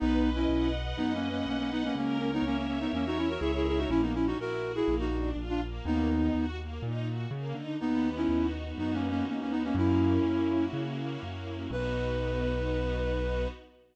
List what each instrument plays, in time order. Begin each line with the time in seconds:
0.00 acoustic grand piano B1, flute B3 D#4, string ensemble 1 B4
0.23 string ensemble 1 D#5
0.35 flute C#4 E4
0.48 acoustic grand piano B1, string ensemble 1 F#5
0.75 string ensemble 1 B4
0.97 acoustic grand piano F#2, flute B3 D#4, string ensemble 1 D#5
1.14 flute A#3 C#4
1.24 string ensemble 1 F#5
1.30 flute A#3 C#4
1.46 acoustic grand piano B1, flute A#3 C#4, string ensemble 1 B4
1.59 flute A#3 C#4
1.70 flute B3 D#4, string ensemble 1 D#5
1.84 flute A#3 C#4
1.95 acoustic grand piano C#2, flute A#3 C#4, string ensemble 1 A#4
2.19 flute A#3 C#4, string ensemble 1 C#5
2.33 flute B3 D#4
2.42 acoustic grand piano C#2, flute A#3 C#4, string ensemble 1 E5
2.57 flute A#3 C#4
2.67 flute A#3 C#4, string ensemble 1 A#4
2.80 flute B3 D#4
2.93 acoustic grand piano E2, flute A#3 C#4, string ensemble 1 C#5
3.06 flute D#4 F#4
3.16 flute C#4 E4, string ensemble 1 E5
3.29 flute F#4 A#4
3.40 acoustic grand piano C#2, flute E4 G#4, string ensemble 1 A#4
3.55 flute E4 G#4
3.65 flute E4 G#4, string ensemble 1 C#5
3.78 flute D#4 F#4
3.89 acoustic grand piano A#1, string ensemble 1 A#3, flute C#4 E4
4.02 flute B3 D#4
4.13 string ensemble 1 C#4, flute C#4 E4
4.26 flute D#4 F#4
4.37 acoustic grand piano A#1, string ensemble 1 E4, flute F#4 A#4
4.62 string ensemble 1 F#4
4.75 flute E4 G#4
4.88 acoustic grand piano A#1, string ensemble 1 A#3
4.99 flute D#4 F#4
5.13 string ensemble 1 D4
5.36 acoustic grand piano A#1, string ensemble 1 F4
5.49 flute D4 F4
5.62 string ensemble 1 A#3
5.85 acoustic grand piano D#2, string ensemble 1 A#3, flute B3 D#4
6.09 string ensemble 1 D#4
6.35 acoustic grand piano D#2, string ensemble 1 F#4
6.59 string ensemble 1 A#3
6.82 acoustic grand piano A#2, string ensemble 1 D#4
7.06 string ensemble 1 F#4
7.31 acoustic grand piano C#3, string ensemble 1 A#3
7.54 acoustic grand piano D3, string ensemble 1 D#4
7.80 acoustic grand piano D#2, flute B3 D#4, string ensemble 1 B3
8.05 string ensemble 1 D#4
8.16 flute C#4 E4
8.29 acoustic grand piano D#2, string ensemble 1 F#4
8.53 string ensemble 1 B3
8.78 acoustic grand piano F#2, flute B3 D#4, string ensemble 1 D#4
8.94 flute A#3 C#4
9.02 string ensemble 1 F#4
9.10 flute A#3 C#4
9.26 acoustic grand piano D#2, flute A#3 C#4, string ensemble 1 B3
9.41 flute A#3 C#4
9.50 flute B3 D#4, string ensemble 1 D#4
9.64 flute A#3 C#4
9.75 acoustic grand piano F#2, string ensemble 1 A#3, flute C#4 E4
9.99 string ensemble 1 C#4
10.24 acoustic grand piano F#2, string ensemble 1 E4
10.48 string ensemble 1 F#4
10.73 acoustic grand piano C#3, string ensemble 1 A#3
10.98 string ensemble 1 C#4
11.21 acoustic grand piano F#2, string ensemble 1 E4
11.45 string ensemble 1 F#4
11.71 acoustic grand piano B1, string ensemble 1 B3 D#4 F#4, flute B4